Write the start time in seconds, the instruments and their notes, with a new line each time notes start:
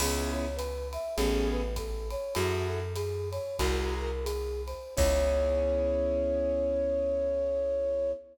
0.00 electric bass (finger) C#2, acoustic grand piano B3 C#4 E4 G#4, flute G#4, crash, ride
0.33 flute C#5
0.56 flute B4, hi-hat pedal, ride
0.93 flute E5, ride
1.16 electric bass (finger) A1, acoustic grand piano B3 C#4 G#4 A4, flute G#4, ride
1.52 flute B4
1.76 flute A4, kick, hi-hat pedal, ride
2.11 flute C#5, ride
2.35 electric bass (finger) F#2, acoustic grand piano E4 F#4 G#4 A4, flute F#4, ride
2.69 flute A4
2.95 flute G#4, hi-hat pedal, ride
3.31 flute C#5, ride
3.59 electric bass (finger) C2, flute F#4, acoustic grand piano F#4 G#4 A#4 C5, kick, ride
3.99 flute A#4
4.24 flute G#4, hi-hat pedal, ride
4.67 flute C5, ride
4.96 electric bass (finger) C#2, acoustic grand piano B3 C#4 E4 G#4, flute C#5, kick, crash